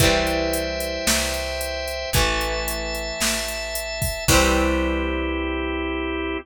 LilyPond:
<<
  \new Staff \with { instrumentName = "Overdriven Guitar" } { \time 4/4 \key c \major \tempo 4 = 112 <e g c'>1 | <e a>1 | <e g c'>1 | }
  \new Staff \with { instrumentName = "Drawbar Organ" } { \time 4/4 \key c \major <c'' e'' g''>1 | <e'' a''>1 | <c' e' g'>1 | }
  \new Staff \with { instrumentName = "Electric Bass (finger)" } { \clef bass \time 4/4 \key c \major c,2 c,2 | a,,2 a,,2 | c,1 | }
  \new DrumStaff \with { instrumentName = "Drums" } \drummode { \time 4/4 <hh bd>8 hh8 hh8 hh8 sn8 hh8 hh8 hh8 | <hh bd>8 hh8 hh8 hh8 sn8 hh8 hh8 <hho bd>8 | <cymc bd>4 r4 r4 r4 | }
>>